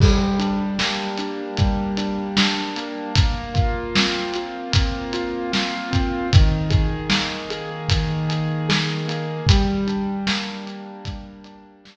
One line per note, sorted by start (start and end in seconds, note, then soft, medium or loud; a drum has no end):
0.00 1.59 G3 loud
0.00 kick loud
0.00 crash loud
0.39 1.18 D4 medium
0.39 closed hi-hat medium
0.79 2.76 A#3 medium
0.79 snare loud
1.18 1.97 D4 medium
1.18 closed hi-hat medium
1.57 3.09 G3 medium
1.57 kick medium
1.57 closed hi-hat medium
1.97 2.37 D4 medium
1.97 closed hi-hat medium
2.37 3.13 D4 medium
2.37 snare loud
2.76 3.14 A#3 medium
2.76 closed hi-hat medium
3.15 4.72 A#3 medium
3.15 kick medium
3.15 closed hi-hat loud
3.54 4.35 F4 medium
3.54 kick medium
3.54 closed hi-hat medium
3.95 5.90 C4 medium
3.95 snare loud
4.34 5.13 F4 medium
4.34 closed hi-hat medium
4.72 6.22 A#3 medium
4.72 kick medium
4.72 closed hi-hat loud
5.13 5.52 F4 medium
5.13 closed hi-hat medium
5.52 6.27 F4 medium
5.52 snare loud
5.91 6.28 C4 medium
5.91 kick medium
5.91 closed hi-hat medium
6.33 7.90 D#3 loud
6.33 kick loud
6.33 closed hi-hat loud
6.70 7.50 G#4 medium
6.70 kick medium
6.70 closed hi-hat medium
7.10 9.07 A#3 medium
7.10 snare loud
7.50 8.28 G#4 medium
7.50 closed hi-hat medium
7.89 9.41 D#3 medium
7.89 kick medium
7.89 closed hi-hat loud
8.29 8.68 G#4 medium
8.29 closed hi-hat medium
8.69 9.44 G#4 medium
8.69 snare loud
9.08 9.45 A#3 medium
9.08 closed hi-hat medium
9.47 11.05 G3 loud
9.47 kick loud
9.47 closed hi-hat loud
9.87 10.66 D4 medium
9.87 closed hi-hat medium
10.27 11.96 A#3 medium
10.27 snare loud
10.66 11.44 D4 medium
10.66 closed hi-hat medium
11.05 11.96 G3 medium
11.05 kick medium
11.05 closed hi-hat medium
11.44 11.83 D4 medium
11.44 closed hi-hat medium
11.84 11.96 D4 medium
11.84 snare loud